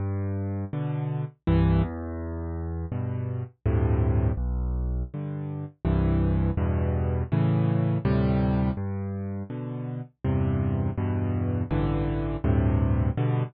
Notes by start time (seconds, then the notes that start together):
0.00 G2
0.73 B2 D3
1.47 C2 G2 E3
1.83 E2
2.92 G2 B2
3.66 D2 G2 A2 C3
4.37 B1
5.14 G2 D3
5.85 C2 G2 E3
6.57 E2 G2 B2
7.32 A2 C#3 E3
8.05 D2 A2 C3 G3
8.77 G2
9.50 B2 D3
10.25 E2 G2 C3
10.98 E2 G2 B2
11.71 A1 G2 D3 E3
12.44 D2 G2 A2 C3
13.17 G2 B2 D3